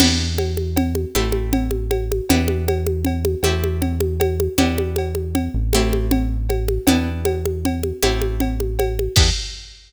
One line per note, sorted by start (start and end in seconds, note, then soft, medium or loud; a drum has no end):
0.00 1.05 E2 loud
0.00 1.11 B3 loud
0.00 1.11 D4 medium
0.00 1.11 E4 medium
0.00 1.11 G4 medium
0.00 crash loud
0.00 cowbell medium
0.00 low conga loud
0.38 cowbell medium
0.38 high conga medium
0.57 high conga medium
0.76 cowbell medium
0.76 low conga loud
0.95 high conga medium
1.15 2.21 A1 loud
1.15 2.27 A3 medium
1.15 2.27 C4 medium
1.15 2.27 E4 medium
1.15 2.27 G4 medium
1.15 cowbell medium
1.15 high conga medium
1.32 high conga medium
1.53 cowbell medium
1.53 low conga loud
1.71 high conga medium
1.91 cowbell medium
1.91 high conga medium
2.12 high conga medium
2.29 3.36 E2 loud
2.29 3.42 B3 medium
2.29 3.42 D4 loud
2.29 3.42 E4 medium
2.29 3.42 G4 medium
2.29 cowbell loud
2.29 low conga loud
2.48 high conga medium
2.68 cowbell medium
2.68 high conga medium
2.87 high conga medium
3.05 cowbell medium
3.05 low conga medium
3.25 high conga medium
3.43 4.48 E2 loud
3.43 4.57 A3 medium
3.43 4.57 C4 medium
3.43 4.57 E4 medium
3.43 4.57 G4 medium
3.43 cowbell medium
3.43 high conga medium
3.64 high conga medium
3.82 cowbell medium
3.82 low conga medium
4.00 high conga medium
4.20 cowbell medium
4.20 high conga loud
4.40 high conga medium
4.58 5.49 E2 loud
4.58 5.70 B3 medium
4.58 5.70 D4 medium
4.58 5.70 E4 medium
4.58 5.70 G4 medium
4.58 cowbell loud
4.58 low conga loud
4.78 high conga medium
4.96 cowbell medium
4.96 high conga medium
5.15 high conga medium
5.35 cowbell medium
5.35 low conga medium
5.54 6.79 A1 loud
5.73 6.87 A3 loud
5.73 6.87 C4 medium
5.73 6.87 E4 medium
5.73 6.87 G4 medium
5.73 cowbell medium
5.73 high conga loud
5.93 high conga medium
6.11 cowbell medium
6.11 low conga loud
6.49 cowbell medium
6.49 high conga medium
6.68 high conga medium
6.87 7.92 E2 loud
6.87 8.01 B3 medium
6.87 8.01 D4 medium
6.87 8.01 E4 medium
6.87 8.01 G4 medium
6.87 cowbell loud
6.87 low conga loud
7.25 cowbell medium
7.25 high conga loud
7.45 high conga medium
7.65 cowbell medium
7.65 low conga medium
7.83 high conga medium
8.02 9.08 A1 loud
8.02 9.15 A3 medium
8.02 9.15 C4 loud
8.02 9.15 E4 medium
8.02 9.15 G4 medium
8.02 cowbell loud
8.02 high conga loud
8.22 high conga medium
8.40 cowbell medium
8.40 low conga medium
8.60 high conga medium
8.79 cowbell loud
8.79 high conga medium
8.99 high conga medium
9.16 9.31 E2 loud
9.16 9.30 B3 loud
9.16 9.30 D4 loud
9.16 9.30 E4 medium
9.16 9.30 G4 loud
9.16 kick loud
9.16 crash loud